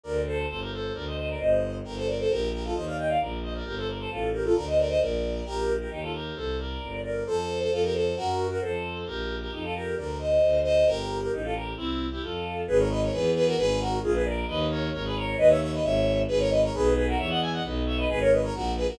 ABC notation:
X:1
M:2/4
L:1/16
Q:1/4=133
K:Gm
V:1 name="Violin"
[Bd]2 [Ac]2 [Ac] [GB] [Ac]2 | [Bd] [ce] [ce] [Bd] [ce]4 | [GB] [Ac] [Bd] [Ac] [GB]2 [GB] [FA] | [ce] [df] [eg] [df] [Bd]2 [ce] [Bd] |
[GB] [Ac] [Bd] [Ac] [FA]2 [GB] [FA] | [Bd] [ce] [Bd] [ce] [Bd]4 | [K:Bb] [GB]3 [GB] [EG] [FA] [GB]2 | [Ac]2 [Bd]4 [Bd]2 |
[Ac]3 [Ac] [FA] [GB] [Ac]2 | [_GB]3 [GB] [Ac]4 | [GB]3 [GB] [EG] [FA] [GB]2 | [Bd]2 [ce]4 [ce]2 |
[GB]3 [GB] [EG] [FA] [GB]2 | [C=E]3 [EG] [FA]4 | [K:G#m] [GB] [Ac] [Bd] [Ac] [GB]2 [GB] [FA] | [GB]2 [FA]2 [^EG] [GB] [A=d]2 |
[Bd]2 [Ac]2 [Ac] [GB] [Ac]2 | [Bd] [ce] [ce] [Bd] [ce]4 | [GB] [Ac] [Bd] [Ac] [GB]2 [GB] [FA] | [ce] [df] [eg] [df] [Bd]2 [ce] [Bd] |
[GB] [Ac] [Bd] [Ac] [FA]2 [GB] [FA] |]
V:2 name="Violin" clef=bass
D,,4 G,,,4 | D,,4 G,,,4 | G,,,4 B,,,4 | E,,4 B,,,4 |
G,,,4 A,,,4 | D,,4 B,,,4 | [K:Bb] B,,,4 E,,4 | C,,4 G,,,4 |
F,,4 F,,4 | _G,,4 F,,4 | B,,,4 F,,4 | D,,4 D,,4 |
G,,,4 A,,,4 | C,,4 F,,4 | [K:G#m] G,,,4 E,,4 | G,,,4 A,,,4 |
D,,4 G,,,4 | D,,4 G,,,4 | G,,,4 B,,,4 | E,,4 B,,,4 |
G,,,4 A,,,4 |]